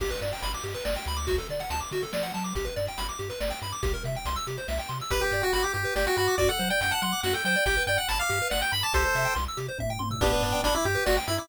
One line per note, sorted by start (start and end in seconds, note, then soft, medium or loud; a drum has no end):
0.00 0.12 G1 medium
0.00 0.11 G4 loud
0.00 kick medium
0.00 crash medium
0.10 0.20 B4 medium
0.10 closed hi-hat medium
0.21 0.33 G2 medium
0.21 0.32 D5 medium
0.21 closed hi-hat medium
0.32 0.42 G5 medium
0.32 closed hi-hat medium
0.42 0.54 G1 medium
0.42 0.52 B5 medium
0.42 closed hi-hat medium
0.53 0.64 D6 medium
0.53 closed hi-hat medium
0.64 0.76 G2 medium
0.64 0.73 G4 medium
0.64 closed hi-hat medium
0.74 0.84 B4 medium
0.74 closed hi-hat medium
0.85 0.97 G1 medium
0.85 0.95 D5 medium
0.85 snare medium
0.96 1.06 G5 medium
0.96 closed hi-hat medium
1.06 1.39 D2 medium
1.06 1.17 B5 medium
1.06 closed hi-hat medium
1.17 1.26 D6 medium
1.17 closed hi-hat medium
1.27 1.36 F#4 medium
1.27 kick medium
1.27 closed hi-hat medium
1.38 1.48 A4 medium
1.38 closed hi-hat medium
1.49 1.61 D3 medium
1.49 1.60 D5 medium
1.49 closed hi-hat medium
1.59 1.70 F#5 medium
1.59 closed hi-hat medium
1.70 1.82 D2 medium
1.70 1.80 A5 medium
1.70 closed hi-hat medium
1.80 1.90 D6 medium
1.80 closed hi-hat medium
1.91 2.03 D3 medium
1.91 2.02 F#4 medium
1.91 closed hi-hat medium
2.02 2.12 A4 medium
2.02 closed hi-hat medium
2.13 2.32 F3 medium
2.13 2.23 D5 medium
2.13 snare medium
2.23 2.33 F#5 medium
2.23 closed hi-hat medium
2.34 2.53 F#3 medium
2.34 2.44 A5 medium
2.34 closed hi-hat medium
2.44 2.54 D6 medium
2.44 closed hi-hat medium
2.55 2.67 G1 medium
2.55 2.65 G4 medium
2.55 kick medium
2.55 closed hi-hat medium
2.65 2.74 B4 medium
2.65 closed hi-hat medium
2.76 2.89 G2 medium
2.76 2.86 D5 medium
2.76 closed hi-hat medium
2.87 2.98 G5 medium
2.87 closed hi-hat medium
2.98 3.10 G1 medium
2.98 3.07 B5 medium
2.98 closed hi-hat medium
3.09 3.18 D6 medium
3.09 closed hi-hat medium
3.19 3.31 G2 medium
3.19 3.29 G4 medium
3.19 closed hi-hat medium
3.30 3.39 B4 medium
3.30 closed hi-hat medium
3.40 3.52 G1 medium
3.40 3.50 D5 medium
3.40 snare medium
3.50 3.60 G5 medium
3.50 closed hi-hat medium
3.62 3.73 G2 medium
3.62 3.72 B5 medium
3.62 closed hi-hat medium
3.72 3.82 D6 medium
3.72 closed hi-hat medium
3.83 3.95 C2 medium
3.83 3.92 G4 loud
3.83 kick loud
3.83 closed hi-hat medium
3.94 4.03 A#4 medium
3.94 closed hi-hat medium
4.04 4.16 C3 medium
4.04 4.15 E5 medium
4.04 closed hi-hat medium
4.15 4.26 G5 medium
4.15 closed hi-hat medium
4.25 4.37 C2 medium
4.25 4.36 C6 medium
4.25 closed hi-hat medium
4.36 4.46 E6 medium
4.36 closed hi-hat medium
4.47 4.59 C3 medium
4.47 4.57 G4 medium
4.47 closed hi-hat medium
4.57 4.67 C5 medium
4.57 closed hi-hat medium
4.68 4.80 C2 medium
4.68 4.78 E5 medium
4.68 snare medium
4.79 4.89 G5 medium
4.79 closed hi-hat medium
4.89 5.01 C3 medium
4.89 4.98 C6 medium
4.89 closed hi-hat medium
5.00 5.11 E6 medium
5.00 closed hi-hat medium
5.10 5.23 G1 medium
5.10 5.20 G4 medium
5.10 5.21 B4 medium
5.10 kick loud
5.10 closed hi-hat medium
5.21 5.42 G4 medium
5.21 5.31 B4 medium
5.32 5.43 G2 medium
5.32 5.42 D5 medium
5.32 closed hi-hat medium
5.42 5.53 F#4 medium
5.42 5.51 G5 medium
5.53 5.65 G1 medium
5.53 5.63 F#4 medium
5.53 5.62 B5 medium
5.53 closed hi-hat medium
5.62 5.73 G4 medium
5.62 5.72 D6 medium
5.73 5.86 G2 medium
5.73 5.83 G4 medium
5.73 5.94 G4 medium
5.73 closed hi-hat medium
5.85 5.94 B4 medium
5.96 6.07 G1 medium
5.96 6.06 G4 medium
5.96 6.05 D5 medium
5.96 snare medium
6.07 6.16 F#4 loud
6.07 6.17 G5 medium
6.17 6.29 G2 medium
6.17 6.35 F#4 medium
6.17 6.27 B5 medium
6.17 closed hi-hat medium
6.27 6.37 D6 medium
6.38 6.50 F#2 medium
6.38 6.49 F#4 loud
6.38 6.48 D5 medium
6.38 kick medium
6.38 closed hi-hat medium
6.49 6.59 A4 medium
6.49 6.69 F#5 medium
6.59 6.71 F#3 medium
6.59 6.69 C5 medium
6.59 closed hi-hat medium
6.70 6.80 D5 medium
6.70 6.80 G5 medium
6.81 6.93 F#2 medium
6.81 6.92 F#5 medium
6.81 6.92 G5 medium
6.81 closed hi-hat medium
6.91 7.01 F#5 medium
6.91 7.01 A5 medium
7.02 7.14 F#3 medium
7.02 7.21 F#5 medium
7.02 7.12 C6 medium
7.02 closed hi-hat medium
7.12 7.22 D6 medium
7.23 7.35 F#2 medium
7.23 7.34 F#4 medium
7.23 7.33 F#5 medium
7.23 snare medium
7.33 7.43 A4 medium
7.33 7.44 G5 medium
7.45 7.56 F#3 medium
7.45 7.55 C5 medium
7.45 7.64 G5 medium
7.45 closed hi-hat medium
7.56 7.65 D5 medium
7.66 7.77 G1 loud
7.66 7.76 G4 medium
7.66 7.83 G5 medium
7.66 kick medium
7.66 closed hi-hat medium
7.77 7.86 B4 medium
7.87 7.99 G2 medium
7.87 7.98 D5 medium
7.87 7.97 G5 medium
7.87 closed hi-hat medium
7.97 8.08 F#5 medium
7.97 8.06 G5 medium
8.08 8.20 G1 medium
8.08 8.19 A5 medium
8.08 8.18 B5 medium
8.08 closed hi-hat medium
8.19 8.48 F5 medium
8.19 8.30 D6 medium
8.29 8.42 G2 medium
8.29 8.39 G4 medium
8.29 closed hi-hat medium
8.42 8.51 B4 medium
8.50 8.63 G1 medium
8.50 8.60 D5 medium
8.50 8.61 F#5 medium
8.50 snare medium
8.62 8.72 G5 medium
8.72 8.84 G2 medium
8.72 8.81 B5 medium
8.72 8.83 B5 medium
8.72 closed hi-hat medium
8.83 8.93 A5 medium
8.83 8.93 D6 medium
8.94 9.05 C2 medium
8.94 9.04 G4 medium
8.94 9.34 A4 medium
8.94 9.34 C5 medium
8.94 kick medium
8.94 closed hi-hat medium
9.05 9.15 C5 medium
9.15 9.27 C3 medium
9.15 9.25 E5 medium
9.15 closed hi-hat medium
9.25 9.34 G5 medium
9.35 9.48 C2 medium
9.35 9.44 C6 medium
9.35 closed hi-hat medium
9.48 9.58 E6 medium
9.57 9.69 C3 medium
9.57 9.67 G4 medium
9.57 closed hi-hat medium
9.68 9.78 C5 medium
9.78 9.98 A2 medium
9.78 9.90 E5 medium
9.78 kick medium
9.78 high tom medium
9.89 10.00 G5 medium
9.89 floor tom medium
9.99 10.19 G#2 medium
9.99 10.09 C6 medium
9.99 high tom medium
10.11 10.20 E6 medium
10.11 floor tom medium
10.21 10.33 G1 loud
10.21 10.61 B3 medium
10.21 10.61 D4 medium
10.21 10.32 G4 loud
10.21 kick loud
10.21 closed hi-hat loud
10.33 10.42 B4 medium
10.42 10.54 G2 medium
10.42 10.53 D5 medium
10.42 closed hi-hat medium
10.52 10.62 G5 medium
10.63 10.75 G1 medium
10.63 10.74 D4 medium
10.63 10.74 B5 loud
10.63 closed hi-hat loud
10.74 10.85 E4 medium
10.74 10.84 D6 medium
10.85 10.97 G2 loud
10.85 11.04 G4 medium
10.85 10.95 G4 medium
10.85 closed hi-hat medium
10.95 11.04 B4 medium
11.06 11.18 G1 loud
11.06 11.16 F#4 medium
11.06 11.15 D5 medium
11.06 snare loud
11.17 11.26 G5 loud
11.27 11.40 G2 medium
11.27 11.38 E4 medium
11.27 11.37 B5 medium
11.27 closed hi-hat medium
11.38 11.48 E4 medium
11.38 11.48 D6 medium